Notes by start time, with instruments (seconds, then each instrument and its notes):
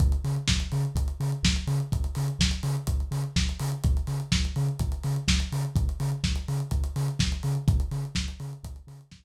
0.00 synth bass 2 C#2, kick, closed hi-hat
0.12 closed hi-hat
0.24 synth bass 2 C#3, open hi-hat
0.36 closed hi-hat
0.48 synth bass 2 C#2, kick, snare
0.60 closed hi-hat
0.72 synth bass 2 C#3, open hi-hat
0.85 closed hi-hat
0.95 synth bass 2 C#2, kick, closed hi-hat
1.08 closed hi-hat
1.20 synth bass 2 C#3, open hi-hat
1.32 closed hi-hat
1.43 synth bass 2 C#2, kick, snare
1.56 closed hi-hat
1.67 synth bass 2 C#3, open hi-hat
1.80 closed hi-hat
1.92 synth bass 2 C#2, kick, closed hi-hat
2.04 closed hi-hat
2.15 synth bass 2 C#3, open hi-hat
2.28 closed hi-hat
2.39 synth bass 2 C#2, kick, snare
2.51 closed hi-hat
2.63 synth bass 2 C#3, open hi-hat
2.77 closed hi-hat
2.87 synth bass 2 C#2, kick, closed hi-hat
3.00 closed hi-hat
3.11 synth bass 2 C#3, open hi-hat
3.24 closed hi-hat
3.36 synth bass 2 C#2, kick, snare
3.49 closed hi-hat
3.60 synth bass 2 C#3, open hi-hat
3.72 closed hi-hat
3.84 synth bass 2 C#2, kick, closed hi-hat
3.97 closed hi-hat
4.07 synth bass 2 C#3, open hi-hat
4.20 closed hi-hat
4.32 synth bass 2 C#2, kick, snare
4.45 closed hi-hat
4.56 synth bass 2 C#3, open hi-hat
4.68 closed hi-hat
4.79 synth bass 2 C#2, kick, closed hi-hat
4.92 closed hi-hat
5.03 synth bass 2 C#3, open hi-hat
5.16 closed hi-hat
5.28 synth bass 2 C#2, kick, snare
5.40 closed hi-hat
5.52 synth bass 2 C#3, open hi-hat
5.65 closed hi-hat
5.76 synth bass 2 C#2, kick, closed hi-hat
5.89 closed hi-hat
6.00 synth bass 2 C#3, open hi-hat
6.12 closed hi-hat
6.24 synth bass 2 C#2, kick, snare
6.36 closed hi-hat
6.48 synth bass 2 C#3, open hi-hat
6.60 closed hi-hat
6.71 synth bass 2 C#2, kick, closed hi-hat
6.84 closed hi-hat
6.96 synth bass 2 C#3, open hi-hat
7.08 closed hi-hat
7.19 synth bass 2 C#2, kick, snare
7.32 closed hi-hat
7.43 synth bass 2 C#3, open hi-hat
7.55 closed hi-hat
7.68 synth bass 2 C#2, kick, closed hi-hat
7.80 closed hi-hat
7.91 synth bass 2 C#3, open hi-hat
8.05 closed hi-hat
8.15 synth bass 2 C#2, kick, snare
8.28 closed hi-hat
8.40 synth bass 2 C#3, open hi-hat
8.53 closed hi-hat
8.63 synth bass 2 C#2, kick, closed hi-hat
8.76 closed hi-hat
8.87 synth bass 2 C#3, open hi-hat
9.01 closed hi-hat
9.11 synth bass 2 C#2, kick, snare
9.23 closed hi-hat